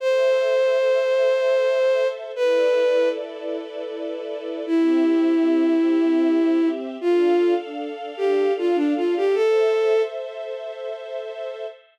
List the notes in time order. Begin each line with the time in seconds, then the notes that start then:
0.00 A4 C5 E5
2.34 E4 A4 B4 D5
4.66 C4 E4 G4 E5
7.01 D4 F4 A4 F5
8.17 G4
8.58 F4
8.75 D4
8.97 F4
9.17 G4
9.34 A4 C5 E5